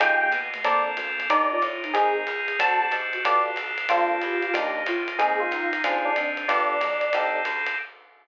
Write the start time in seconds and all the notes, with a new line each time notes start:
0.00 F2 G#3 D#4 F4 G4 G#4 G5, kick, ride
0.21 A#3 G5
0.32 B2, hi-hat pedal, ride
0.54 A3, ride
0.64 A#1 A#3 C4 D4 A4 A#4 D5, kick, ride
0.97 D2, hi-hat pedal, ride
1.20 ride
1.30 D#2 D4 D#4 G4 A#4 D5, kick, ride
1.51 F4 D5
1.62 A2, hi-hat pedal, ride
1.83 D#4, ride
1.94 G#1 C4 D#4 G#4 A#4, kick, ride
2.27 C#2, hi-hat pedal, ride
2.48 ride
2.59 D2 C4 D4 F#4 A4 A5, kick, ride
2.81 G4 A5
2.91 G#2, hi-hat pedal, ride
3.13 F#4, ride
3.24 G1 B3 F4 G4 A4 D5, kick, ride
3.56 B1, hi-hat pedal, ride
3.78 ride
3.89 A#1 A#3 C4 D4 F4 A4, kick, ride
4.22 E2 G4, hi-hat pedal, ride
4.42 ride
4.53 D#2 A#3 D4 D#4 G4, kick, ride
4.86 A2 F4, hi-hat pedal, ride
5.08 ride
5.18 G#1 A#3 C4 D#4 G#4, kick, ride
5.40 F4
5.51 C#2 D#4, hi-hat pedal, ride
5.73 ride
5.84 D2 C4 D4 F4 G#4, kick, ride
6.05 D4
6.16 G#2 C4, hi-hat pedal, ride
6.37 ride
6.48 G1 B3 D4 F4 G4 A4 D5, kick, ride
6.80 B1 F3, hi-hat pedal, ride
7.01 ride
7.13 C2 C4 D#4 G4 A4, kick, ride
7.45 D2, hi-hat pedal, ride
7.67 ride